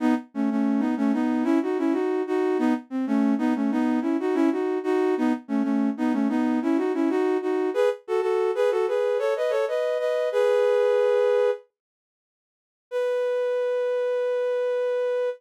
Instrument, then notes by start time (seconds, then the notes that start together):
flute
0.00 B3 D#4
0.34 A3 C#4
0.50 A3 C#4
0.79 B3 D#4
0.97 A3 C#4
1.13 B3 D#4
1.44 C#4 E4
1.62 D#4 F#4
1.78 C#4 E4
1.93 D#4 F#4
2.27 D#4 F#4
2.58 B3 D#4
2.90 C4
3.07 A3 C#4
3.38 B3 D#4
3.55 A3 C#4
3.71 B3 D#4
4.01 C#4 E4
4.20 D#4 F#4
4.34 C#4 E4
4.52 D#4 F#4
4.83 D#4 F#4
5.17 B3 D#4
5.48 A3 C#4
5.63 A3 C#4
5.97 B3 D#4
6.13 A3 C#4
6.29 B3 D#4
6.62 C#4 E4
6.77 D#4 F#4
6.94 C#4 E4
7.09 D#4 F#4
7.42 D#4 F#4
7.74 G#4 B4
8.08 F#4 A4
8.21 F#4 A4
8.55 G#4 B4
8.71 F#4 A4
8.87 G#4 B4
9.19 A4 C#5
9.36 B4 D#5
9.50 A4 C#5
9.68 B4 D#5
9.99 B4 D#5
10.32 G#4 B4
12.91 B4